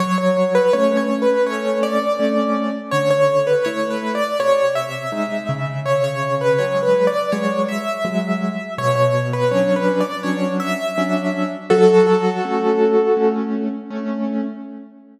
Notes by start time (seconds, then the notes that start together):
0.00 F#3 C#5
0.18 C#5
0.55 B4
0.73 A3 C#4 C#5
0.97 C#5
1.22 B4
1.46 A3 C#4 C#5
1.83 D5
2.19 A3 C#4
2.91 D3 C#5
3.11 C#5
3.47 B4
3.64 A3 E4 C#5
3.90 B4
4.15 D5
4.39 C3 C#5
4.75 E5
5.12 G#3 D#4
5.49 C#3
5.86 C#5
6.04 C#5
6.41 B4
6.59 F#3 G#3 C#5
6.83 B4
7.07 D5
7.32 F#3 G#3 C#5
7.68 E5
8.05 F#3 G#3
8.78 B2 C#5
8.96 C#5
9.33 B4
9.51 F#3 C#4 D4 C#5
9.76 B4
10.00 D5
10.23 F#3 C#4 D4 C#5
10.60 E5
10.98 F#3 C#4 D4
11.70 F#3 F#4 A4
12.45 A3 C#4
13.17 A3 C#4
13.90 A3 C#4